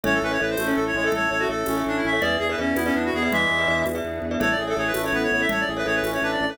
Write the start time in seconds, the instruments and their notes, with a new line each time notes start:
0.03 drawbar organ A1, clarinet C#4 C#5, pad 5 (bowed) C#4 E4 A4, glockenspiel A4 C#5 E5, low conga
0.14 clarinet A4
0.22 drawbar organ A1, clarinet C#4 B4
0.31 glockenspiel A4 C#5 E5, clarinet C#5
0.40 drawbar organ A1, glockenspiel A4 C#5 E5, clarinet B4
0.50 clarinet C5
0.57 drawbar organ A1, clarinet A3, tambourine, high conga
0.67 clarinet C#4, glockenspiel A4 C#5 E5
0.76 drawbar organ A1, clarinet A4
0.87 clarinet C#5
0.94 drawbar organ A1, clarinet G#3 C#5
1.04 glockenspiel A4 C#5 E5, clarinet A4
1.12 drawbar organ A1, pad 5 (bowed) A3 C#4 A4, clarinet A4 C#5, low conga
1.30 drawbar organ A1, clarinet A4 C#5
1.39 clarinet F#4, glockenspiel A4 C#5 E5
1.49 drawbar organ A1, glockenspiel A4 C#5 E5, clarinet A4
1.66 drawbar organ A1, clarinet C#4, tambourine, high conga
1.77 glockenspiel A4 C#5 E5
1.86 drawbar organ A1, clarinet D4
1.97 clarinet E4
2.03 drawbar organ A1, clarinet C#4 E5
2.13 glockenspiel A4 C#5 E5
2.20 drawbar organ E2, pad 5 (bowed) B3 D4 E4 G#4, glockenspiel G#4 B4 D5 E5, clarinet G#4 D5, low conga
2.39 drawbar organ E2, clarinet G#4
2.49 glockenspiel G#4 B4 D5 E5, clarinet B4
2.58 drawbar organ E2, clarinet C#4, glockenspiel G#4 B4 D5 E5
2.75 drawbar organ E2, clarinet B3 E4, tambourine, high conga
2.85 clarinet C#4, glockenspiel G#4 B4 D5 E5
2.95 drawbar organ E2, clarinet D4
3.05 clarinet F#4
3.13 drawbar organ E2, clarinet B3 G#4
3.22 glockenspiel G#4 B4 D5 E5, clarinet G#4
3.31 drawbar organ E2, clarinet E3 G#3 E5, pad 5 (bowed) B3 D4 G#4 B4, low conga
3.51 drawbar organ E2
3.58 glockenspiel G#4 B4 D5 E5
3.67 drawbar organ E2, glockenspiel G#4 B4 D5 E5
3.86 drawbar organ E2, tambourine, high conga
3.95 glockenspiel G#4 B4 D5 E5
4.04 drawbar organ E2
4.22 drawbar organ E2
4.31 glockenspiel G#4 B4 D5 E5
4.40 drawbar organ A1, pad 5 (bowed) C#4 E4 A4, glockenspiel A4 C#5 E5, clarinet A4 C#5, low conga
4.51 clarinet D5
4.58 drawbar organ A1, clarinet G#4
4.67 glockenspiel A4 C#5 E5, clarinet A4
4.77 drawbar organ A1, clarinet G#4 C#5, glockenspiel A4 C#5 E5
4.87 clarinet B4
4.94 drawbar organ A1, clarinet A3, tambourine, high conga
5.04 glockenspiel A4 C#5 E5, clarinet C#5
5.12 drawbar organ A1, clarinet B3 B4
5.23 clarinet C#5
5.31 drawbar organ A1, clarinet C#5
5.40 glockenspiel A4 C#5 E5, clarinet E5
5.49 drawbar organ A1, pad 5 (bowed) A3 C#4 A4, clarinet A4 C#5, low conga
5.60 clarinet D5
5.67 drawbar organ A1, clarinet G#4
5.77 glockenspiel A4 C#5 E5, clarinet B4
5.85 drawbar organ A1, clarinet G#4 C#5, glockenspiel A4 C#5 E5
5.95 clarinet B4
6.03 drawbar organ A1, clarinet C#4, tambourine, high conga
6.13 glockenspiel A4 C#5 E5, clarinet C#5
6.22 drawbar organ A1, clarinet D4 B4
6.32 clarinet D5
6.40 drawbar organ A1, clarinet D5
6.49 glockenspiel A4 C#5 E5, clarinet B4